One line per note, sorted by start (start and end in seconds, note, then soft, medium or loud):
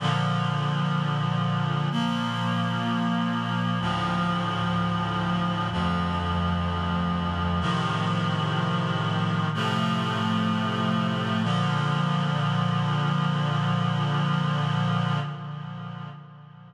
0.00 1.88 A#2 medium
0.00 1.88 D3 medium
0.00 1.88 F3 medium
1.91 3.79 A#2 medium
1.91 3.79 F3 medium
1.91 3.79 A#3 medium
3.80 5.69 D2 medium
3.80 5.69 A2 medium
3.80 5.69 F3 loud
5.71 7.60 D2 medium
5.71 7.60 F2 medium
5.71 7.60 F3 medium
7.61 9.49 A2 loud
7.61 9.49 C3 medium
7.61 9.49 D#3 loud
7.61 9.49 F3 medium
9.54 11.43 A2 medium
9.54 11.43 C3 medium
9.54 11.42 F3 medium
9.54 11.43 A3 loud
11.43 15.20 A#2 loud
11.43 15.20 D3 loud
11.43 15.20 F3 loud